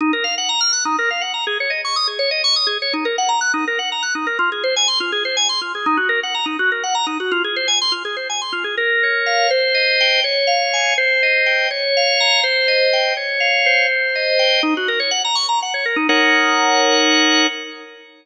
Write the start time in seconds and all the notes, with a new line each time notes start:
0.01 D#4
0.13 A#4
0.24 F5
0.38 F#5
0.49 A#5
0.61 F6
0.73 F#6
0.85 D#4
0.99 A#4
1.10 F5
1.21 F#5
1.34 A#5
1.47 G#4
1.60 C#5
1.70 D#5
1.85 C#6
1.96 D#6
2.07 G#4
2.19 C#5
2.31 D#5
2.44 C#6
2.56 D#6
2.67 G#4
2.82 C#5
2.93 D#4
3.05 A#4
3.18 F#5
3.29 A#5
3.41 F#6
3.54 D#4
3.67 A#4
3.79 F#5
3.92 A#5
4.03 F#6
4.15 D#4
4.27 A#4
4.39 F4
4.52 G#4
4.64 C5
4.76 G#5
4.88 C6
5.00 F4
5.12 G#4
5.25 C5
5.37 G#5
5.49 C6
5.61 F4
5.75 G#4
5.86 D#4
5.97 F#4
6.09 A#4
6.23 F#5
6.34 A#5
6.46 D#4
6.59 F#4
6.72 A#4
6.83 F#5
6.95 A#5
7.07 D#4
7.20 F#4
7.32 F4
7.44 G#4
7.56 C5
7.68 G#5
7.82 C6
7.92 F4
8.05 G#4
8.17 C5
8.30 G#5
8.42 C6
8.53 F4
8.64 G#4
8.77 A#4
9.03 C#5
9.26 F5
9.50 C5
9.74 D#5
10.01 G5
10.24 C#5
10.47 F5
10.73 G#5
10.98 C5
11.23 D#5
11.46 G5
11.71 C#5
11.97 F5
12.20 A#5
12.43 C5
12.68 D#5
12.93 G5
13.17 C#5
13.40 F5
13.66 C5
14.15 D#5
14.39 G5
14.63 D#4
14.77 F#4
14.88 A#4
15.00 C#5
15.11 F#5
15.24 A#5
15.35 C#6
15.49 A#5
15.62 F#5
15.74 C#5
15.85 A#4
15.96 D#4
16.09 D#4 A#4 C#5 F#5